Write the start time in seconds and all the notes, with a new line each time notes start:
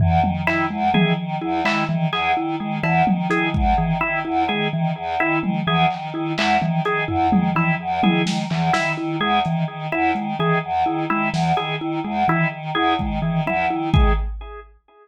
0.00 E2 E3, floor tom
0.22 D#3, high tom
0.47 D#3 E4, clap
0.70 E2 G#3
0.94 D#3 E3 G#4, high tom
1.17 D#3
1.41 E2 E4
1.65 D#3 G#3 E4, clap
1.89 D#3 E3, high tom
2.13 E2 G#4, clap
2.37 D#3 E4
2.59 D#3 G#3
2.83 E2 E3 E4, cowbell
3.07 D#3, high tom
3.30 D#3 E4 G#4, closed hi-hat
3.54 E2 G#3, kick
3.78 D#3 E3
4.01 D#3 E4
4.25 E2 E4
4.49 D#3 G#3 G#4
4.72 D#3 E3
4.96 E2
5.19 D#3 E4
5.42 D#3 G#3, high tom
5.66 E2 E3 G#4
5.91 D#3, clap
6.14 D#3 E4
6.37 E2 G#3 E4, clap
6.61 D#3 E3, high tom
6.84 D#3 G#4, closed hi-hat
7.08 E2 E4, floor tom
7.31 D#3 G#3, high tom
7.55 D#3 E3 E4, cowbell
7.80 E2
8.03 D#3 E4 G#4, high tom
8.25 D#3 G#3, snare
8.50 E2 E3, clap
8.73 D#3 E4, snare
8.98 D#3 E4
9.20 E2 G#3 G#4
9.45 D#3 E3, closed hi-hat
9.68 D#3
9.92 E2 E4
10.15 D#3 G#3, closed hi-hat
10.39 D#3 E3 G#4
10.63 E2
10.86 D#3 E4
11.10 D#3 G#3 E4
11.33 E2 E3, snare
11.57 D#3 G#4
11.80 D#3 E4
12.05 E2 G#3
12.28 D#3 E3 E4
12.52 D#3
12.75 E2 E4 G#4
12.99 D#3 G#3, kick
13.22 D#3 E3
13.46 E2 E4, high tom
13.70 D#3 E4
13.94 D#3 G#3 G#4, kick